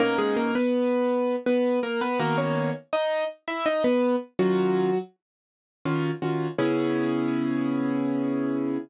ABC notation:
X:1
M:3/4
L:1/16
Q:1/4=82
K:C#dor
V:1 name="Acoustic Grand Piano"
[A,A] [G,G] [A,A] [B,B]5 [B,B]2 [A,A] [B,B] | [A,A] [Cc]2 z [Dd]2 z [Ee] [Dd] [B,B]2 z | [F,F]4 z8 | C12 |]
V:2 name="Acoustic Grand Piano"
[B,,A,CD]12 | [D,A,B,F]12 | [D,C^E]8 [D,CEF]2 [D,CEF]2 | [C,B,EG]12 |]